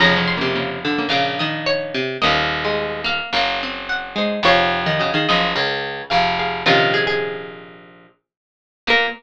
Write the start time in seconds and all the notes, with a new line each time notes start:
0.00 F1 F2 C#3 F3 C#4 A#5
0.17 F3 C#4
0.28 C6
0.37 C3 C#3 A#3
0.55 C#3 A#3
0.85 D3
0.98 C#3 A#3
1.09 A#1 A#2 C#3 F5
1.39 D#3 D#5
1.66 C#5
1.94 C3
2.22 D#1 D#2 A#3 C#4 A#4 D#5
2.64 G#3
3.04 A#3 F5
3.33 F#1 F#2 A#3
3.63 C4
3.89 F#5
4.16 G#3 D#4 C5
4.43 F1 F2 F3 G#4 C#5 F5
4.86 D#3
4.99 C#3 F#4 D#5
5.14 D#3 G#4 F5
5.29 F#1 F#2 F3 D#5
5.55 C#2 C#3 C#4 A#4
6.10 F1 F2 G#4 F5
6.39 G#4 F5
6.66 A#1 A#2 C3 D#3 C#4 F4 A#4
6.94 G#4
7.07 G#4
8.87 A#2 A#3 A#4